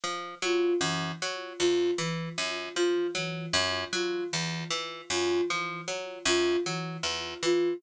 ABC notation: X:1
M:5/8
L:1/8
Q:1/4=77
K:none
V:1 name="Pizzicato Strings" clef=bass
F, _G, _G,, G, E,, | E, _G,, F, _G, G,, | _G, E,, E, _G,, F, | _G, _G,, G, E,, E, |]
V:2 name="Ocarina"
z F E, z F | E, z F E, z | F E, z F E, | z F E, z F |]